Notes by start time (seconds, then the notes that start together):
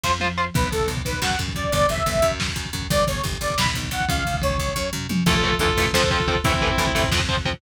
0.04 F2 F4 C5, kick, snare
0.20 F4 C5, high tom
0.38 F4 C5
0.54 B1 B4, kick, crash
0.63 kick
0.71 B1 A4, kick, ride
0.80 kick
0.88 B1, kick, ride
0.97 kick
1.05 B1 B4, kick, ride
1.13 kick
1.22 F#2 F#5, kick, snare
1.30 kick
1.39 F#2, kick, ride
1.48 kick
1.55 F#2 D5, kick, ride
1.64 kick
1.72 G1 D5, kick, ride
1.81 kick
1.88 G1 E5, kick, ride
1.98 kick
2.06 G1, kick, ride
2.15 kick
2.22 F#2, kick, ride
2.31 kick
2.40 kick, snare
2.48 kick
2.56 F#2, kick, ride
2.65 kick
2.73 F#2, kick, ride
2.82 kick
2.90 G1 D5, kick, ride
3.00 kick
3.07 G1 C#5, kick, ride
3.15 kick
3.24 G1, kick, ride
3.33 kick
3.41 G1 D5, kick, ride
3.50 kick
3.58 B1 B5, kick, snare
3.66 kick
3.74 B1, kick, ride
3.83 kick
3.91 B1 F#5, kick, ride
4.01 kick
4.08 C#2 F5, kick, ride
4.17 kick
4.25 C#2, kick, ride
4.34 kick
4.42 C#2 C#5, kick, ride
4.50 kick
4.58 C#2, kick, ride
4.68 kick
4.76 F#2, kick, floor tom
4.93 F#2, mid tom
5.09 F#2, high tom
5.26 A1 E3 A3 F4 A4, kick, crash
5.35 kick
5.43 E3 A3, kick, floor tom
5.52 kick
5.59 D2 E3 A3 F4 A4, kick, floor tom
5.69 kick
5.77 A1 E3 A3, kick, floor tom
5.86 kick
5.93 F2 F3 C4 A4 C5, kick, snare
6.03 kick
6.10 F3 C4 F4 A4, kick, floor tom
6.20 kick
6.28 F3 C4, kick, floor tom
6.35 kick
6.44 A1 E3 A3 C4 E4, kick, floor tom
6.54 kick
6.61 E3 A3, kick, floor tom
6.70 kick
6.78 D2 E3 A3, kick, floor tom
6.87 kick
6.95 A1 E3 A3, kick, floor tom
7.03 kick
7.11 F2 F3 C4, kick, snare
7.20 kick
7.29 F3 C4, kick, floor tom
7.37 kick
7.45 F3 C4, kick, floor tom
7.53 kick